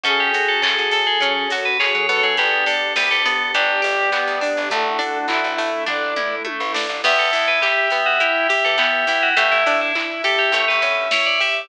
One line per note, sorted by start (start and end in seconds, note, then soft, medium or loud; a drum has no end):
0.04 0.30 F#2 medium
0.04 1.19 C#4 medium
0.04 1.23 C#4 medium
0.04 0.31 C#4 loud
0.04 1.19 F#4 medium
0.04 1.19 G#4 medium
0.04 1.52 G#4 medium
0.04 1.19 A4 medium
0.04 0.19 A4 loud
0.04 kick loud
0.04 closed hi-hat medium
0.20 0.45 G4 medium
0.34 0.60 F#4 medium
0.34 1.52 F#4 medium
0.34 open hi-hat medium
0.48 0.62 A4 medium
0.62 0.75 C#3 medium
0.62 0.90 G#4 medium
0.62 1.80 G#4 medium
0.62 0.88 A4 medium
0.62 kick medium
0.62 clap loud
0.78 1.05 F#2 medium
0.91 1.06 A4 medium
0.91 1.19 A4 loud
0.91 2.32 A4 medium
0.91 open hi-hat medium
1.07 1.21 G#4 medium
1.20 1.47 F#3 medium
1.20 1.48 C#4 loud
1.20 2.37 C#4 medium
1.20 2.34 C#4 medium
1.20 2.37 F#4 medium
1.20 1.46 A4 medium
1.20 2.37 A4 medium
1.20 2.37 C#5 medium
1.20 kick medium
1.20 closed hi-hat loud
1.50 1.78 F#2 medium
1.50 1.77 F#4 medium
1.50 2.35 F#4 medium
1.50 open hi-hat medium
1.65 1.79 B4 medium
1.79 2.06 G#4 medium
1.79 2.36 G#4 medium
1.79 2.07 C#5 medium
1.79 kick medium
1.79 clap loud
1.95 2.21 F#3 medium
2.09 3.25 B3 medium
2.09 2.35 A4 medium
2.09 2.23 C#5 medium
2.09 open hi-hat medium
2.23 2.37 F#3 medium
2.23 2.37 G#4 medium
2.37 2.65 G1 medium
2.37 2.64 B3 loud
2.37 3.54 B3 medium
2.37 3.54 D4 medium
2.37 2.65 G4 loud
2.37 3.54 G4 medium
2.37 2.66 D5 medium
2.37 kick medium
2.37 closed hi-hat medium
2.66 3.54 D4 medium
2.66 2.93 D4 medium
2.66 2.91 A4 medium
2.66 open hi-hat medium
2.96 3.10 D2 medium
2.96 3.23 G4 medium
2.96 3.82 G4 medium
2.96 3.10 B4 medium
2.96 kick medium
2.96 snare loud
3.11 3.38 D2 medium
3.11 3.25 A4 loud
3.25 3.52 B3 loud
3.25 4.12 B3 medium
3.25 3.51 A4 medium
3.25 open hi-hat medium
3.54 3.81 G1 medium
3.54 4.71 G3 medium
3.54 4.71 B3 medium
3.54 3.81 D4 loud
3.54 4.41 D4 medium
3.54 4.40 G4 medium
3.54 4.71 G4 medium
3.54 4.60 D5 medium
3.54 kick medium
3.54 closed hi-hat loud
3.82 4.10 G1 medium
3.82 4.65 G4 medium
3.82 4.10 G4 medium
3.82 open hi-hat medium
4.12 4.68 B3 medium
4.12 4.39 B3 medium
4.12 kick medium
4.12 clap loud
4.27 4.54 D2 medium
4.41 4.69 D4 medium
4.41 4.68 D4 medium
4.41 4.70 D4 medium
4.41 open hi-hat medium
4.57 4.70 G1 medium
4.70 4.99 A1 medium
4.70 4.97 A3 loud
4.70 5.87 A3 medium
4.70 5.58 A3 medium
4.70 5.87 D4 medium
4.70 5.87 E4 medium
4.70 5.47 F#4 medium
4.70 5.18 A4 medium
4.70 5.47 A4 medium
4.70 kick loud
4.70 closed hi-hat loud
4.99 5.86 D4 medium
4.99 5.26 D4 medium
4.99 open hi-hat medium
5.28 5.41 A1 medium
5.28 5.84 E4 medium
5.28 5.56 E4 medium
5.28 6.16 E4 medium
5.28 kick medium
5.28 clap medium
5.44 5.70 A1 medium
5.58 6.44 A3 medium
5.58 5.85 A3 loud
5.58 open hi-hat medium
5.87 6.14 A1 medium
5.87 7.04 A3 medium
5.87 6.74 D4 medium
5.87 6.14 D4 loud
5.87 7.04 E4 medium
5.87 7.04 A4 medium
5.87 6.35 D5 medium
5.87 kick medium
5.87 floor tom medium
6.16 6.43 E2 medium
6.16 6.99 E4 medium
6.16 6.43 E4 medium
6.16 mid tom medium
6.45 7.00 A3 medium
6.45 6.72 A3 medium
6.45 high tom medium
6.60 6.87 A1 medium
6.74 7.02 D4 medium
6.74 7.01 D4 medium
6.74 snare loud
6.89 7.02 A1 medium
7.03 7.17 E2 medium
7.03 7.91 B3 medium
7.03 7.30 B3 loud
7.03 7.18 G4 loud
7.03 9.29 E5 medium
7.03 kick loud
7.03 crash loud
7.18 7.31 E2 medium
7.18 7.45 A4 medium
7.33 7.61 E2 medium
7.33 8.20 E4 medium
7.33 7.59 E4 medium
7.33 open hi-hat medium
7.48 7.62 B4 medium
7.61 7.91 G4 medium
7.61 7.89 G4 medium
7.61 8.49 G4 medium
7.61 kick medium
7.61 clap loud
7.90 8.18 B3 medium
7.90 8.77 B3 medium
7.90 8.05 G4 medium
7.90 open hi-hat medium
8.06 8.20 F#4 medium
8.20 9.08 E4 medium
8.20 8.47 E4 loud
8.20 8.47 G4 medium
8.20 kick medium
8.20 closed hi-hat medium
8.49 8.63 G4 medium
8.49 8.76 G4 medium
8.49 9.33 G4 medium
8.49 open hi-hat medium
8.65 8.92 E3 medium
8.65 8.79 A4 medium
8.78 9.33 B3 medium
8.78 9.05 B3 medium
8.78 9.07 G4 medium
8.78 kick medium
8.78 clap loud
9.07 9.33 E2 medium
9.07 9.34 E4 medium
9.07 9.36 E4 medium
9.07 9.22 G4 medium
9.07 open hi-hat medium
9.23 9.37 F#4 medium
9.37 9.50 A1 medium
9.37 10.47 A3 medium
9.37 9.63 A3 loud
9.37 9.51 G4 medium
9.37 11.61 E5 medium
9.37 kick loud
9.37 closed hi-hat loud
9.52 9.65 A1 medium
9.52 9.77 E4 medium
9.66 9.92 A2 medium
9.66 9.92 D4 loud
9.66 10.50 D4 medium
9.66 open hi-hat medium
9.81 9.95 E4 medium
9.95 10.22 E4 medium
9.95 10.51 E4 medium
9.95 kick medium
9.95 clap medium
10.24 10.52 G4 medium
10.24 10.51 G4 medium
10.24 10.38 A4 loud
10.24 open hi-hat medium
10.39 10.53 G4 medium
10.52 10.65 A1 medium
10.52 11.64 A3 medium
10.52 10.80 A3 loud
10.52 10.68 C#5 medium
10.52 kick medium
10.52 closed hi-hat loud
10.68 10.83 A1 medium
10.68 10.96 B4 medium
10.82 11.08 E2 medium
10.82 11.65 C#4 medium
10.82 11.09 C#4 medium
10.82 open hi-hat medium
11.11 11.38 E4 medium
11.11 11.69 E4 medium
11.11 11.26 C#5 medium
11.11 kick medium
11.11 snare loud
11.26 11.40 D5 medium
11.40 11.68 G4 medium
11.40 11.67 G4 medium
11.40 11.55 E5 medium
11.40 open hi-hat medium